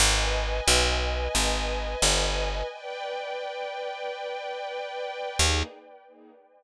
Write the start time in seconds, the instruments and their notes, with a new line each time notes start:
0.00 electric bass (finger) G#1, string ensemble 1 B4 D#5 G#5
0.68 electric bass (finger) B1
1.35 electric bass (finger) G#1
2.02 electric bass (finger) G1
2.70 string ensemble 1 B4 D5 G5
5.39 electric bass (finger) D#2, string ensemble 1 A#3 D#4 G#4